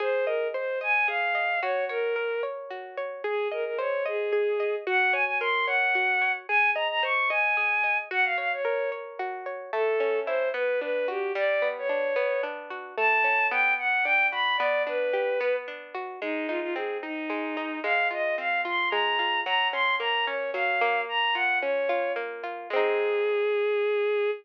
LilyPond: <<
  \new Staff \with { instrumentName = "Violin" } { \time 6/8 \key aes \mixolydian \tempo 4. = 74 c''8 bes'8 c''8 aes''8 f''4 | des''8 bes'4 r4. | aes'8 bes'16 bes'16 des''8 aes'4. | ges''8 aes''16 aes''16 c'''8 ges''4. |
aes''8 bes''16 bes''16 des'''8 aes''4. | ges''16 f''16 f''16 des''8. r4. | \key a \mixolydian a'4 c''8 b'8 b'8 g'8 | d''8. cis''4~ cis''16 r4 |
a''4 g''8 fis''8 g''8 b''8 | d''8 b'4. r4 | \key aes \mixolydian ees'8 f'16 f'16 aes'8 ees'4. | f''8 ees''8 f''8 c'''8 bes''4 |
bes''8 c'''8 bes''8 des''8 f''4 | bes''8 ges''8 des''4 r4 | aes'2. | }
  \new Staff \with { instrumentName = "Acoustic Guitar (steel)" } { \time 6/8 \key aes \mixolydian aes'8 ees''8 c''8 ees''8 aes'8 ees''8 | ges'8 des''8 bes'8 des''8 ges'8 des''8 | aes'8 ees''8 c''8 ees''8 aes'8 ees''8 | ges'8 des''8 bes'8 des''8 ges'8 des''8 |
aes'8 ees''8 c''8 ees''8 aes'8 ees''8 | ges'8 des''8 bes'8 des''8 ges'8 des''8 | \key a \mixolydian a8 cis'8 e'8 b8 d'8 fis'8 | g8 b8 d'8 b8 d'8 fis'8 |
a8 cis'8 b4 d'8 fis'8 | b8 d'8 g'8 b8 d'8 fis'8 | \key aes \mixolydian aes8 ees'8 c'8 ees'8 aes8 ees'8 | aes8 f'8 c'8 f'8 aes8 f'8 |
ges8 des'8 bes8 des'8 ges8 bes8~ | bes8 f'8 des'8 f'8 bes8 f'8 | <aes c' ees'>2. | }
>>